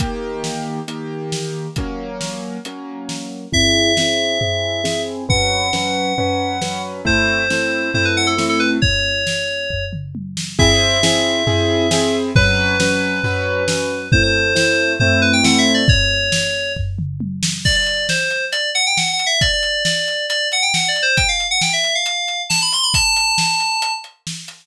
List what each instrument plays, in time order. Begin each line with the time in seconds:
0.00 acoustic grand piano D#3 A#3 G4, kick, closed hi-hat
0.44 snare
0.88 acoustic grand piano D#3 A#3 G4, closed hi-hat
1.32 snare
1.76 acoustic grand piano F#3 A#3 C#4, kick, closed hi-hat
2.21 snare
2.65 acoustic grand piano F#3 A#3 C#4, closed hi-hat
3.09 snare
3.52 acoustic grand piano C4 E4 G#4, electric piano 2 E5, kick, floor tom
3.97 acoustic grand piano C4 E4 G#4, snare
4.41 acoustic grand piano C4 E4 G#4, floor tom
4.84 acoustic grand piano C4 E4 G#4, snare
5.29 acoustic grand piano F#3 C#4 B4, electric piano 2 F#5, kick, floor tom
5.73 acoustic grand piano F#3 C#4 B4, snare
6.18 acoustic grand piano F#3 C#4 B4, floor tom
6.61 acoustic grand piano F#3 C#4 B4, snare
7.05 acoustic grand piano A3 C4 E4, electric piano 2 C5, kick, floor tom
7.50 acoustic grand piano A3 C4 E4, snare
7.94 acoustic grand piano A3 C4 E4, electric piano 2 C5, floor tom
8.05 electric piano 2 B4
8.17 electric piano 2 F#5
8.27 electric piano 2 A4
8.38 acoustic grand piano A3 C4 E4, snare
8.49 electric piano 2 A4
8.60 electric piano 2 B4
8.82 electric piano 2 C#5, kick, floor tom
9.27 snare
9.70 kick, floor tom
9.93 mid tom
10.15 high tom
10.37 snare
10.59 acoustic grand piano C4 E4 G#4, electric piano 2 E5, kick, floor tom
11.03 acoustic grand piano C4 E4 G#4, snare
11.47 acoustic grand piano C4 E4 G#4, floor tom
11.91 acoustic grand piano C4 E4 G#4, snare
12.35 acoustic grand piano F#3 C#4 B4, electric piano 2 B4, kick, floor tom
12.80 acoustic grand piano F#3 C#4 B4, snare
13.24 acoustic grand piano F#3 C#4 B4, floor tom
13.68 acoustic grand piano F#3 C#4 B4, snare
14.12 acoustic grand piano A3 C4 E4, electric piano 2 C5, kick, floor tom
14.23 electric piano 2 C5
14.55 acoustic grand piano A3 C4 E4, electric piano 2 C5, snare
15.00 acoustic grand piano A3 C4 E4, electric piano 2 C5, floor tom
15.22 electric piano 2 B4
15.33 electric piano 2 G5
15.44 acoustic grand piano A3 C4 E4, electric piano 2 F#5, snare
15.58 electric piano 2 E5
15.74 electric piano 2 D5
15.88 electric piano 2 C#5, kick, floor tom
16.32 snare
16.76 kick, floor tom
16.99 mid tom
17.20 high tom
17.43 snare
17.65 electric piano 2 D5, kick, crash
17.76 electric piano 2 D5
17.86 closed hi-hat
18.09 electric piano 2 C5, snare
18.30 closed hi-hat
18.52 electric piano 2 D5, closed hi-hat
18.75 electric piano 2 F#5, closed hi-hat
18.86 electric piano 2 G5
18.97 electric piano 2 F#5, snare
19.13 electric piano 2 F#5
19.19 closed hi-hat
19.26 electric piano 2 E5
19.41 electric piano 2 D5, kick, closed hi-hat
19.53 electric piano 2 D5
19.63 closed hi-hat
19.85 electric piano 2 D5, snare
20.08 closed hi-hat
20.29 electric piano 2 D5, closed hi-hat
20.52 electric piano 2 F#5, closed hi-hat
20.62 electric piano 2 G5
20.74 electric piano 2 F#5, snare
20.88 electric piano 2 D5
20.96 closed hi-hat
21.02 electric piano 2 C5
21.17 electric piano 2 G5, kick, closed hi-hat
21.28 electric piano 2 F5
21.40 closed hi-hat
21.51 electric piano 2 F#5
21.61 electric piano 2 G5, snare
21.73 electric piano 2 E5
21.84 closed hi-hat
21.95 electric piano 2 F5
22.06 closed hi-hat
22.28 closed hi-hat
22.50 electric piano 2 A5, snare
22.62 electric piano 2 B5
22.72 electric piano 2 C6, closed hi-hat
22.83 electric piano 2 B5
22.94 electric piano 2 A5, kick, closed hi-hat
23.16 closed hi-hat
23.38 snare
23.60 closed hi-hat
23.82 closed hi-hat
24.04 closed hi-hat
24.27 snare
24.48 closed hi-hat